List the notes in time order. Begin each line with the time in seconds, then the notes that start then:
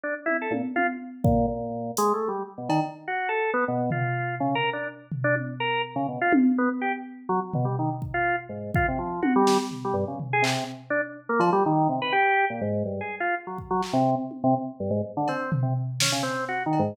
0.04 D4
0.26 E4, high tom
0.42 A4
0.51 A#2, high tom
0.76 F4, high tom
1.24 A#2, kick
1.48 A#2
1.97 G#3, closed hi-hat
2.14 A3
2.28 G3
2.58 B2
2.69 D#3, cowbell
3.08 F#4
3.29 A4
3.54 B3
3.68 B2
3.91 F4, floor tom
4.40 C#3
4.55 A#4
4.73 D4
5.12 floor tom
5.24 D4
5.36 high tom
5.60 A#4
5.96 C#3
6.08 B2
6.21 F4
6.33 high tom
6.58 B3
6.81 G4
7.29 F#3
7.54 B2, floor tom
7.65 G3
7.79 D#3
8.02 kick
8.14 F4
8.49 G#2
8.74 F4, kick
8.88 C3
8.99 F3
9.22 F#4, high tom
9.36 G3
9.47 snare
9.71 floor tom
9.85 G3
9.94 G2
10.08 C#3
10.20 floor tom
10.33 G#4
10.42 C3, clap
10.90 D4
11.29 A#3
11.40 F3, cowbell
11.53 G3
11.66 D#3
11.89 C3
12.02 B4
12.13 G4
12.50 A#2
12.61 G#2
12.85 G2
13.01 G#4
13.20 F4
13.47 F#3
13.58 kick
13.71 F#3
13.83 clap
13.93 C3
14.31 high tom
14.44 C3
14.80 G2
14.91 G#2
15.17 D3
15.28 C4, cowbell
15.52 floor tom
15.63 C3
16.00 C#4, snare
16.12 C#3
16.23 C4
16.48 F#4
16.66 D#3
16.73 cowbell
16.79 G#2